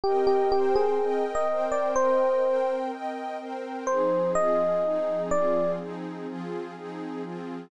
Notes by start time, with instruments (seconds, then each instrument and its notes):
0.04 pad 2 (warm) C4 A#4 D#5 G5, electric piano 1 G4
0.27 electric piano 1 G4
0.52 pad 2 (warm) C4 A#4 C5 G5, electric piano 1 G4
0.76 electric piano 1 G#4
0.99 pad 2 (warm) C4 A#4 D#5 G5
1.35 electric piano 1 D#5
1.48 pad 2 (warm) C4 A#4 C5 G5
1.72 electric piano 1 D5
1.95 pad 2 (warm) C4 A#4 D#5 G5, electric piano 1 C5
2.43 pad 2 (warm) C4 A#4 C5 G5
2.92 pad 2 (warm) C4 A#4 D#5 G5
3.39 pad 2 (warm) C4 A#4 C5 G5
3.87 pad 2 (warm) F3 C4 D#4 G#4, electric piano 1 C5
4.35 pad 2 (warm) F3 C4 F4 G#4, electric piano 1 D#5
4.83 pad 2 (warm) F3 C4 D#4 G#4
5.31 pad 2 (warm) F3 C4 F4 G#4, electric piano 1 D5
5.79 pad 2 (warm) F3 C4 D#4 G#4
6.27 pad 2 (warm) F3 C4 F4 G#4
6.76 pad 2 (warm) F3 C4 D#4 G#4
7.23 pad 2 (warm) F3 C4 F4 G#4